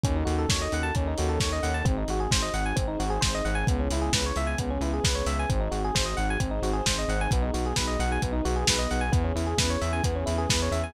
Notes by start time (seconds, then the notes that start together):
0.04 D#2 C#4 D#4 F#4 A4, kick, closed hi-hat
0.16 D#4
0.25 D#2 F#4, open hi-hat
0.39 A4
0.48 D#2 C#5, kick, snare
0.62 D#5
0.72 D#2 F#5, open hi-hat
0.83 A5
0.95 D#2 C#4 D#4 A4 C#5, kick, closed hi-hat
1.07 D#4
1.18 D#2 F#4, open hi-hat
1.29 A4
1.40 D#2 C#5, kick, snare
1.53 D#5
1.63 D#2 F#5, open hi-hat
1.74 A5
1.85 G#1 C4 D#4 F#4 G#4, kick, closed hi-hat
1.98 D#4
2.08 G#1 F#4, open hi-hat
2.20 G#4
2.31 G#1 C5, kick, snare
2.42 D#5
2.54 G#1 F#5, open hi-hat
2.66 G#5
2.76 G#1 C4 D#4 G#4 C5, kick, closed hi-hat
2.88 D#4
2.99 G#1 F#4, open hi-hat
3.10 G#4
3.21 G#1 C5, kick, snare
3.35 D#5
3.45 G#1 F#5, open hi-hat
3.55 G#5
3.67 C#2 B3 C#4 E4 G#4, kick, closed hi-hat
3.80 C#4
3.91 C#2 E4, open hi-hat
4.02 G#4
4.13 C#2 B4, kick, snare
4.26 C#5
4.36 C#2 E5, open hi-hat
4.47 G#5
4.58 C#2 B3 C#4 G#4 B4, kick, closed hi-hat
4.70 C#4
4.81 C#2 E4, open hi-hat
4.93 G#4
5.04 C#2 B4, kick, snare
5.15 C#5
5.26 C#2 E5, open hi-hat
5.39 G#5
5.49 G#1 C4 D#4 F#4 G#4, kick, closed hi-hat
5.60 D#4
5.71 G#1 F#4, open hi-hat
5.84 G#4
5.95 G#1 C5, kick, snare
6.06 D#5
6.17 G#1 F#5, open hi-hat
6.30 G#5
6.40 G#1 C4 D#4 G#4 C5, kick, closed hi-hat
6.51 D#4
6.62 G#1 F#4, open hi-hat
6.73 G#4
6.86 G#1 C5, kick, snare
6.98 D#5
7.08 G#1 F#5, open hi-hat
7.21 G#5
7.31 B1 B3 D#4 F#4 G#4, kick, closed hi-hat
7.42 D#4
7.54 B1 F#4, open hi-hat
7.66 G#4
7.76 B1 B4, kick, snare
7.87 D#5
7.99 B1 F#5, open hi-hat
8.12 G#5
8.22 B1 B3 D#4 G#4 B4, kick, closed hi-hat
8.32 D#4
8.45 B1 F#4, open hi-hat
8.56 G#4
8.67 B1 B4, kick, snare
8.79 D#5
8.91 B1 F#5, open hi-hat
9.01 G#5
9.12 E2 B3 C#4 E4 G#4, kick, closed hi-hat
9.24 C#4
9.35 E2 E4, open hi-hat
9.47 G#4
9.58 E2 B4, kick, snare
9.70 C#5
9.81 E2 E5, open hi-hat
9.93 G#5
10.04 E2 B3 C#4 G#4 B4, kick, closed hi-hat
10.16 C#4
10.26 E2 E4, open hi-hat
10.38 G#4
10.49 E2 B4, kick, snare
10.62 C#5
10.71 E2 E5, open hi-hat
10.84 G#5